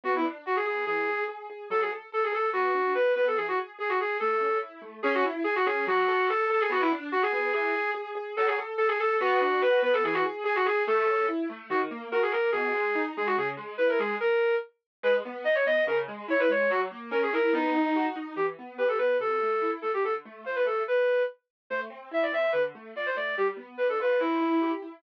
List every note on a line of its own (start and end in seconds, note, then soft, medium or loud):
0.04 0.22 B3 medium
0.04 0.14 F#4 loud
0.15 0.25 E4 medium
0.24 0.43 D4 medium
0.46 0.64 F#4 medium
0.46 0.56 F#4 medium
0.56 0.65 G#4 medium
0.65 0.84 B3 medium
0.65 0.85 G#4 medium
0.86 1.06 E3 medium
0.86 1.23 G#4 loud
1.08 1.26 G#4 medium
1.28 1.47 G#4 medium
1.50 1.68 G#4 medium
1.70 1.89 F#3 medium
1.70 1.81 A4 loud
1.80 1.90 G#4 medium
1.91 2.10 A4 medium
2.12 2.31 A4 medium
2.12 2.23 A4 medium
2.24 2.34 G#4 medium
2.32 2.51 A4 medium
2.32 2.49 A4 medium
2.53 2.72 B3 medium
2.53 2.93 F#4 loud
2.74 2.93 D4 medium
2.95 3.14 F#4 medium
2.95 3.12 B4 medium
3.15 3.35 B3 medium
3.15 3.25 B4 medium
3.27 3.37 A4 medium
3.36 3.56 E3 medium
3.36 3.46 G#4 medium
3.48 3.58 F#4 medium
3.57 3.76 G#4 medium
3.79 3.97 G#4 medium
3.79 3.90 G#4 medium
3.89 3.99 F#4 medium
4.00 4.19 G#4 medium
4.00 4.17 G#4 medium
4.20 4.40 A3 medium
4.20 4.58 A4 loud
4.41 4.60 C#4 medium
4.62 4.81 E4 medium
4.82 5.00 A3 medium
5.03 5.23 C#4 loud
5.03 5.13 G#4 loud
5.14 5.24 F#4 loud
5.25 5.43 E4 medium
5.44 5.54 G#4 loud
5.44 5.64 G#4 medium
5.56 5.65 F#4 loud
5.65 5.85 C#4 medium
5.65 5.85 G#4 loud
5.87 6.06 F#3 loud
5.87 6.28 F#4 loud
6.08 6.27 A4 loud
6.29 6.49 A4 loud
6.29 6.48 A4 medium
6.50 6.68 A4 medium
6.50 6.61 A4 loud
6.60 6.70 G#4 loud
6.70 6.88 B3 loud
6.70 6.81 F#4 loud
6.80 6.90 E4 loud
6.92 7.11 D4 loud
7.12 7.22 F#4 loud
7.12 7.31 F#4 medium
7.22 7.32 G#4 loud
7.32 7.51 B3 medium
7.32 7.52 G#4 loud
7.53 7.73 E3 loud
7.53 7.90 G#4 loud
7.75 7.94 G#4 medium
7.94 8.13 G#4 medium
8.15 8.34 G#4 medium
8.37 8.56 F#3 loud
8.37 8.47 A4 loud
8.46 8.56 G#4 loud
8.58 8.77 A4 medium
8.78 8.88 A4 loud
8.78 8.97 A4 medium
8.88 8.98 G#4 loud
9.00 9.16 A4 loud
9.00 9.19 A4 medium
9.20 9.39 B3 loud
9.20 9.61 F#4 loud
9.41 9.60 D4 medium
9.61 9.80 F#4 medium
9.61 9.79 B4 loud
9.82 10.01 B3 medium
9.82 9.93 B4 loud
9.93 10.03 A4 loud
10.04 10.23 E3 loud
10.04 10.14 G#4 loud
10.13 10.23 F#4 loud
10.25 10.43 G#4 medium
10.44 10.63 G#4 medium
10.44 10.55 G#4 loud
10.55 10.65 F#4 loud
10.66 10.84 G#4 medium
10.66 10.83 G#4 loud
10.87 11.06 A3 loud
10.87 11.26 A4 loud
11.07 11.25 C#4 medium
11.28 11.47 E4 medium
11.49 11.68 A3 medium
11.70 11.89 D#3 loud
11.70 11.80 F#4 loud
11.91 12.10 A#3 medium
12.12 12.31 F#4 medium
12.12 12.22 A#4 loud
12.22 12.32 G#4 loud
12.31 12.52 A#3 medium
12.31 12.50 A#4 loud
12.52 12.72 B2 loud
12.52 13.02 G#4 loud
12.74 12.93 G#3 medium
12.95 13.14 D#4 medium
13.17 13.36 G#3 medium
13.17 13.27 G#4 medium
13.26 13.36 F#4 loud
13.37 13.56 C#3 medium
13.37 13.48 G#4 loud
13.57 13.76 G#3 medium
13.78 13.98 E4 medium
13.78 13.88 B4 medium
13.89 13.99 A#4 medium
13.99 14.18 G#3 medium
13.99 14.15 G#4 medium
14.20 14.55 A#4 loud
15.03 15.22 G#3 loud
15.03 15.13 B4 loud
15.25 15.44 B3 medium
15.44 15.63 D#4 medium
15.44 15.55 D#5 loud
15.55 15.65 C#5 loud
15.66 15.85 B3 medium
15.66 15.83 D#5 loud
15.87 16.06 C#3 loud
15.87 15.97 A#4 loud
16.08 16.27 G#3 medium
16.28 16.47 E4 medium
16.28 16.40 C#5 loud
16.39 16.49 B4 loud
16.49 16.67 G#3 medium
16.49 16.70 C#5 medium
16.70 16.89 F#3 loud
16.70 16.80 F#4 loud
16.91 17.10 A#3 medium
17.11 17.30 C#4 loud
17.11 17.21 A#4 medium
17.23 17.33 G#4 loud
17.33 17.52 E4 medium
17.33 17.53 A#4 loud
17.53 17.72 B3 loud
17.53 18.06 D#4 loud
17.75 17.93 D#4 medium
17.96 18.15 F#4 medium
18.16 18.34 D#4 medium
18.36 18.55 E3 medium
18.36 18.46 G4 medium
18.59 18.78 B3 medium
18.78 18.97 G4 medium
18.78 18.88 B4 medium
18.88 18.98 A4 medium
18.98 19.18 B3 medium
18.98 19.17 B4 medium
19.19 19.38 C3 medium
19.19 19.71 A4 medium
19.42 19.61 A3 medium
19.62 19.80 E4 medium
19.82 20.02 A3 medium
19.82 19.92 A4 medium
19.94 20.04 G4 medium
20.03 20.22 D3 medium
20.03 20.14 A4 medium
20.25 20.44 A3 medium
20.45 20.63 F4 medium
20.45 20.56 C5 medium
20.55 20.65 B4 medium
20.65 20.84 A3 medium
20.65 20.83 A4 medium
20.88 21.22 B4 medium
21.70 21.89 A3 medium
21.70 21.80 C5 medium
21.90 22.09 C4 medium
22.11 22.30 E4 medium
22.11 22.23 E5 medium
22.22 22.32 D5 medium
22.32 22.51 C4 medium
22.32 22.51 E5 medium
22.52 22.72 D3 medium
22.52 22.62 B4 medium
22.75 22.94 A3 medium
22.96 23.14 F4 medium
22.96 23.06 D5 medium
23.06 23.16 C5 medium
23.16 23.35 A3 medium
23.16 23.35 D5 medium
23.37 23.57 G3 medium
23.37 23.47 G4 medium
23.57 23.75 B3 medium
23.77 23.98 D4 medium
23.77 23.87 B4 medium
23.89 23.99 A4 medium
24.00 24.18 F4 medium
24.00 24.20 B4 medium
24.19 24.39 C4 medium
24.19 24.71 E4 medium
24.41 24.59 E4 medium
24.62 24.80 G4 medium
24.82 25.01 E4 medium